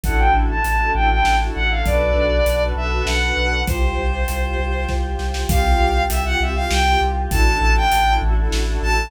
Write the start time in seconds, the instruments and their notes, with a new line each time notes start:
0.03 synth bass 2 A1, string ensemble 1 D4 E4 F#4 A4, choir aahs D4 E4 F#4 A4, violin F#5, kick, closed hi-hat
0.19 violin G5
0.33 synth bass 2 A1
0.50 violin A5
0.64 synth bass 2 A1, violin A5, closed hi-hat
0.80 string ensemble 1 D4 E4 F#4 A4
0.94 synth bass 2 A1, string ensemble 1 D4 E4 F#4 A4, violin G5
1.09 string ensemble 1 D4 E4 F#4 A4, violin G5
1.24 synth bass 2 A1, snare
1.40 string ensemble 1 D4 E4 F#4 A4
1.55 synth bass 2 A1, violin F#5
1.71 violin F5
1.85 synth bass 2 B1, string ensemble 1 D4 F#4 A4 B4, choir aahs D4 F#4 A4 B4, violin D5, kick, closed hi-hat
2.15 synth bass 2 B1
2.46 synth bass 2 B1, closed hi-hat
2.60 string ensemble 1 D4 F#4 A4 B4
2.76 synth bass 2 B1, string ensemble 1 D4 F#4 A4 B4, violin E5
2.91 string ensemble 1 D4 F#4 A4 B4
3.06 synth bass 2 B1, violin F#5, snare
3.22 string ensemble 1 D4 F#4 A4 B4
3.37 synth bass 2 B1
3.67 synth bass 2 C2, choir aahs F4 G4 C5, string ensemble 1 F4 G4 C5, violin C5, kick, closed hi-hat
3.98 synth bass 2 C2
4.28 synth bass 2 C2, closed hi-hat
4.45 string ensemble 1 F4 G4 C5
4.59 synth bass 2 C2, string ensemble 1 F4 G4 C5
4.75 string ensemble 1 F4 G4 C5
4.88 synth bass 2 C2, kick, snare
5.03 string ensemble 1 F4 G4 C5
5.19 synth bass 2 C2, snare
5.34 snare
5.49 synth bass 2 C2, string ensemble 1 C4 F4 G4, choir aahs C4 F4 G4, violin F5, kick, closed hi-hat
5.80 synth bass 2 C2
6.10 synth bass 2 C2, violin E5, closed hi-hat
6.25 string ensemble 1 C4 F4 G4, violin F#5
6.40 synth bass 2 C2, string ensemble 1 C4 F4 G4, violin E5
6.55 string ensemble 1 C4 F4 G4, violin F5
6.70 synth bass 2 C2, violin G5, snare
6.86 string ensemble 1 C4 F4 G4
7.01 synth bass 2 C2
7.31 synth bass 2 A1, string ensemble 1 D4 E4 F#4 A4, choir aahs D4 E4 F#4 A4, violin A5, kick, closed hi-hat
7.61 synth bass 2 A1
7.76 violin G5
7.92 synth bass 2 A1, closed hi-hat
8.08 string ensemble 1 D4 E4 F#4 A4
8.22 synth bass 2 A1, string ensemble 1 D4 E4 F#4 A4
8.37 string ensemble 1 D4 E4 F#4 A4
8.52 synth bass 2 A1, snare
8.67 string ensemble 1 D4 E4 F#4 A4
8.82 synth bass 2 A1, violin A5